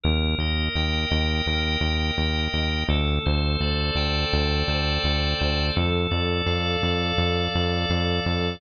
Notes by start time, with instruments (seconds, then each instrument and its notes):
0.03 synth bass 1 D#2, drawbar organ A#4
0.38 synth bass 1 D#2, drawbar organ D#5
0.75 synth bass 1 D#2, drawbar organ G5
1.10 synth bass 1 D#2, drawbar organ D#5
1.46 synth bass 1 D#2, drawbar organ A#4
1.81 synth bass 1 D#2, drawbar organ D#5
2.18 synth bass 1 D#2, drawbar organ G5
2.53 synth bass 1 D#2, drawbar organ D#5
2.88 synth bass 1 D2, drawbar organ A4
3.26 synth bass 1 D2, drawbar organ C5
3.60 synth bass 1 D2, drawbar organ D5
3.95 synth bass 1 D2, drawbar organ G5
4.32 synth bass 1 D2, drawbar organ D5
4.68 synth bass 1 D2, drawbar organ C5
5.03 synth bass 1 D2, drawbar organ A4
5.39 synth bass 1 D2, drawbar organ C5
5.76 synth bass 1 F2, drawbar organ A4
6.11 synth bass 1 F2, drawbar organ D5
6.46 synth bass 1 F2, drawbar organ F5
6.82 synth bass 1 F2, drawbar organ D5
7.18 synth bass 1 F2, drawbar organ A4
7.54 synth bass 1 F2, drawbar organ D5
7.89 synth bass 1 F2, drawbar organ F5
8.24 synth bass 1 F2, drawbar organ D5